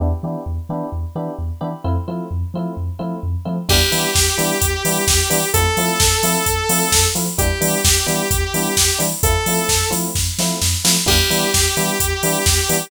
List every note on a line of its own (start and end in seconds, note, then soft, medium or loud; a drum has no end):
0.00 0.13 E2 medium
0.00 0.08 B3 medium
0.00 0.08 D4 medium
0.00 0.08 E4 medium
0.00 0.08 G4 medium
0.23 0.36 E3 medium
0.23 0.40 B3 medium
0.23 0.40 D4 medium
0.23 0.40 E4 medium
0.23 0.40 G4 medium
0.46 0.59 E2 medium
0.69 0.82 E3 medium
0.69 0.86 B3 medium
0.69 0.86 D4 medium
0.69 0.86 E4 medium
0.69 0.86 G4 medium
0.92 1.05 E2 medium
1.15 1.28 E3 medium
1.15 1.32 B3 medium
1.15 1.32 D4 medium
1.15 1.32 E4 medium
1.15 1.32 G4 medium
1.38 1.51 E2 medium
1.61 1.74 E3 medium
1.61 1.69 B3 medium
1.61 1.69 D4 medium
1.61 1.69 E4 medium
1.61 1.69 G4 medium
1.84 1.97 F2 medium
1.84 1.92 A3 medium
1.84 1.92 C4 medium
1.84 1.92 E4 medium
1.84 1.92 F4 medium
2.08 2.20 F3 medium
2.08 2.24 A3 medium
2.08 2.24 C4 medium
2.08 2.24 E4 medium
2.08 2.24 F4 medium
2.31 2.43 F2 medium
2.54 2.67 F3 medium
2.54 2.71 A3 medium
2.54 2.71 C4 medium
2.54 2.71 E4 medium
2.54 2.71 F4 medium
2.77 2.90 F2 medium
2.99 3.13 F3 medium
2.99 3.15 A3 medium
2.99 3.15 C4 medium
2.99 3.15 E4 medium
2.99 3.15 F4 medium
3.23 3.36 F2 medium
3.45 3.59 F3 medium
3.45 3.53 A3 medium
3.45 3.53 C4 medium
3.45 3.53 E4 medium
3.45 3.53 F4 medium
3.69 3.82 E2 medium
3.69 3.77 G3 medium
3.69 3.77 B3 loud
3.69 3.77 D4 loud
3.69 3.77 E4 loud
3.69 5.48 G4 loud
3.69 kick loud
3.69 crash loud
3.92 4.05 E3 medium
3.92 4.08 G3 medium
3.92 4.08 B3 medium
3.92 4.08 D4 medium
3.92 4.08 E4 medium
3.92 open hi-hat medium
4.15 4.28 E2 medium
4.15 kick loud
4.15 snare loud
4.38 4.51 E3 medium
4.38 4.54 G3 medium
4.38 4.54 B3 medium
4.38 4.54 D4 medium
4.38 4.54 E4 medium
4.38 open hi-hat medium
4.62 4.74 E2 medium
4.62 kick loud
4.62 closed hi-hat loud
4.85 4.97 E3 medium
4.85 5.01 G3 medium
4.85 5.01 B3 medium
4.85 5.01 D4 medium
4.85 5.01 E4 medium
4.85 open hi-hat loud
5.08 5.20 E2 medium
5.08 kick loud
5.08 snare loud
5.30 5.43 E3 medium
5.30 5.38 G3 medium
5.30 5.38 B3 loud
5.30 5.38 D4 medium
5.30 5.38 E4 medium
5.30 open hi-hat loud
5.54 5.67 F2 medium
5.54 5.62 A3 loud
5.54 5.62 C4 medium
5.54 5.62 E4 medium
5.54 5.62 F4 medium
5.54 7.04 A4 loud
5.54 kick loud
5.54 closed hi-hat loud
5.77 5.90 F3 medium
5.77 5.94 A3 medium
5.77 5.94 C4 medium
5.77 5.94 E4 medium
5.77 5.94 F4 medium
5.77 open hi-hat medium
6.00 6.13 F2 medium
6.00 kick loud
6.00 snare loud
6.23 6.36 F3 medium
6.23 6.40 A3 medium
6.23 6.40 C4 medium
6.23 6.40 E4 medium
6.23 6.40 F4 medium
6.23 open hi-hat loud
6.46 6.59 F2 medium
6.46 kick loud
6.46 closed hi-hat loud
6.69 6.82 F3 medium
6.69 6.86 A3 medium
6.69 6.86 C4 medium
6.69 6.86 E4 medium
6.69 6.86 F4 medium
6.69 open hi-hat loud
6.92 7.05 F2 medium
6.92 kick loud
6.92 snare loud
7.15 7.28 F3 medium
7.15 7.23 A3 medium
7.15 7.23 C4 medium
7.15 7.23 E4 medium
7.15 7.23 F4 medium
7.15 open hi-hat medium
7.38 7.51 E2 medium
7.38 7.46 G3 loud
7.38 7.46 B3 medium
7.38 7.46 D4 medium
7.38 7.46 E4 loud
7.38 9.00 G4 loud
7.38 kick loud
7.38 closed hi-hat loud
7.61 7.74 E3 medium
7.61 7.77 G3 medium
7.61 7.77 B3 medium
7.61 7.77 D4 medium
7.61 7.77 E4 medium
7.61 open hi-hat loud
7.85 7.97 E2 medium
7.85 kick loud
7.85 snare loud
8.06 8.20 E3 medium
8.06 8.23 G3 loud
8.06 8.23 B3 medium
8.06 8.23 D4 medium
8.06 8.23 E4 medium
8.06 open hi-hat medium
8.31 8.43 E2 medium
8.31 kick loud
8.31 closed hi-hat loud
8.54 8.67 E3 medium
8.54 8.70 G3 medium
8.54 8.70 B3 medium
8.54 8.70 D4 medium
8.54 8.70 E4 medium
8.54 open hi-hat medium
8.77 8.90 E2 medium
8.77 kick medium
8.77 snare loud
8.99 9.13 E3 medium
8.99 9.07 G3 medium
8.99 9.07 B3 medium
8.99 9.07 D4 medium
8.99 9.07 E4 medium
8.99 open hi-hat medium
9.23 9.36 F2 medium
9.23 9.32 A3 loud
9.23 9.32 C4 medium
9.23 9.32 E4 loud
9.23 9.32 F4 loud
9.23 9.89 A4 loud
9.23 kick loud
9.23 closed hi-hat loud
9.46 9.59 F3 medium
9.46 9.63 A3 loud
9.46 9.63 C4 medium
9.46 9.63 E4 medium
9.46 9.63 F4 medium
9.46 open hi-hat loud
9.69 9.82 F2 medium
9.69 kick medium
9.69 snare loud
9.91 10.05 F3 medium
9.91 10.07 A3 medium
9.91 10.07 C4 medium
9.91 10.07 E4 medium
9.91 10.07 F4 medium
9.91 open hi-hat medium
10.15 10.28 F2 medium
10.15 kick loud
10.15 snare loud
10.38 10.51 F3 medium
10.38 10.55 A3 medium
10.38 10.55 C4 medium
10.38 10.55 E4 loud
10.38 10.55 F4 medium
10.38 snare loud
10.62 10.74 F2 medium
10.62 snare loud
10.84 10.97 F3 medium
10.84 10.92 A3 medium
10.84 10.92 C4 medium
10.84 10.92 E4 medium
10.84 10.92 F4 medium
10.84 snare loud
11.06 11.20 E2 medium
11.06 11.14 G3 medium
11.06 11.14 B3 loud
11.06 11.14 D4 loud
11.06 11.14 E4 loud
11.06 12.86 G4 loud
11.06 kick loud
11.06 crash loud
11.30 11.43 E3 medium
11.30 11.46 G3 medium
11.30 11.46 B3 medium
11.30 11.46 D4 medium
11.30 11.46 E4 medium
11.30 open hi-hat medium
11.54 11.67 E2 medium
11.54 kick loud
11.54 snare loud
11.77 11.90 E3 medium
11.77 11.93 G3 medium
11.77 11.93 B3 medium
11.77 11.93 D4 medium
11.77 11.93 E4 medium
11.77 open hi-hat medium
12.00 12.13 E2 medium
12.00 kick loud
12.00 closed hi-hat loud
12.23 12.36 E3 medium
12.23 12.39 G3 medium
12.23 12.39 B3 medium
12.23 12.39 D4 medium
12.23 12.39 E4 medium
12.23 open hi-hat loud
12.46 12.59 E2 medium
12.46 kick loud
12.46 snare loud
12.69 12.82 E3 medium
12.69 12.77 G3 medium
12.69 12.77 B3 loud
12.69 12.77 D4 medium
12.69 12.77 E4 medium
12.69 open hi-hat loud